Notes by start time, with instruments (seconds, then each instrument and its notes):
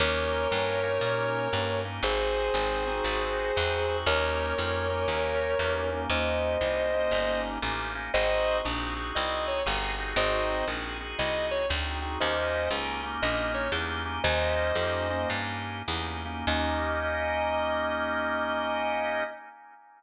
0.00 electric bass (finger) D#2, drawbar organ A#3 C#4 D#4 G4, distortion guitar A#4 C#5
0.51 electric bass (finger) G2, drawbar organ A#3 C#4 D#4 G4
0.83 drawbar organ A#3 C#4 D#4 G4
1.01 electric bass (finger) A#2
1.53 electric bass (finger) G2, drawbar organ A#3 C#4 D#4 G4
1.85 drawbar organ A#3 C#4 D#4 G4
2.03 electric bass (finger) G#1, drawbar organ C4 D#4 F#4 G#4, distortion guitar G#4 C5
2.54 electric bass (finger) G#1, drawbar organ C4 D#4 F#4 G#4
2.87 drawbar organ C4 D#4 F#4 G#4
3.04 electric bass (finger) G#1
3.56 electric bass (finger) E2, drawbar organ C4 D#4 F#4 G#4
3.88 drawbar organ C4 D#4 F#4 G#4
4.06 electric bass (finger) D#2, drawbar organ A#3 C#4 D#4 G4, distortion guitar A#4 C#5
4.57 electric bass (finger) F2, drawbar organ A#3 C#4 D#4 G4
4.90 drawbar organ A#3 C#4 D#4 G4
5.08 electric bass (finger) D#2
5.59 electric bass (finger) E2, drawbar organ A#3 C#4 D#4 G4
5.92 drawbar organ A#3 C#4 D#4 G4
6.10 electric bass (finger) D#2, drawbar organ A#3 C#4 D#4 G4, distortion guitar C5 D#5
6.61 electric bass (finger) C2, drawbar organ A#3 C#4 D#4 G4
6.93 drawbar organ A#3 C#4 D#4 G4
7.11 electric bass (finger) G1
7.62 electric bass (finger) A1, drawbar organ A#3 C#4 D#4 G4
7.95 drawbar organ A#3 C#4 D#4 G4
8.14 electric bass (finger) G#1, drawbar organ C4 D#4 F#4 G#4, distortion guitar C5 D#5
8.64 electric bass (finger) A#1, drawbar organ C4 D#4 F#4 G#4
8.96 drawbar organ C4 D#4 F#4 G#4
9.15 electric bass (finger) C2, distortion guitar D#5
9.48 distortion guitar C#5
9.66 electric bass (finger) G1, drawbar organ C4 D#4 F#4 G#4
9.98 drawbar organ C4 D#4 F#4 G#4
10.16 electric bass (finger) G#1, drawbar organ C4 D#4 F#4 G#4, distortion guitar C5 D#5
10.68 electric bass (finger) A#1, drawbar organ C4 D#4 F#4 G#4
11.00 drawbar organ C4 D#4 F#4 G#4
11.19 electric bass (finger) C2, distortion guitar D#5
11.51 distortion guitar C#5
11.69 electric bass (finger) D2, drawbar organ C4 D#4 F#4 G#4
12.02 drawbar organ C4 D#4 F#4 G#4
12.20 electric bass (finger) D#2, drawbar organ A#3 C#4 D#4 G4, distortion guitar C5 D#5
12.71 electric bass (finger) C#2, drawbar organ A#3 C#4 D#4 G4
13.03 drawbar organ A#3 C#4 D#4 G4
13.22 electric bass (finger) A#1, distortion guitar D#5
13.54 distortion guitar C#5
13.72 electric bass (finger) E2, drawbar organ A#3 C#4 D#4 G4
14.05 drawbar organ A#3 C#4 D#4 G4
14.24 electric bass (finger) D#2, drawbar organ A#3 C#4 D#4 G4, distortion guitar C5 D#5
14.75 electric bass (finger) F2, drawbar organ A#3 C#4 D#4 G4
15.10 drawbar organ A#3 C#4 D#4 G4
15.30 electric bass (finger) G2
15.88 electric bass (finger) E2, drawbar organ A#3 C#4 D#4 G4
16.25 drawbar organ A#3 C#4 D#4 G4
16.47 electric bass (finger) D#2, drawbar organ A#3 C#4 D#4 G4, distortion guitar D#5